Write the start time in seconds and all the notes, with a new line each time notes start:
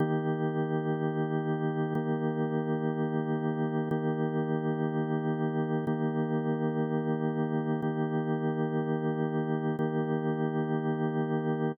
0.00 D#3 A#3 G4
1.95 D#3 A#3 G4
3.91 D#3 A#3 G4
5.87 D#3 A#3 G4
7.82 D#3 A#3 G4
9.79 D#3 A#3 G4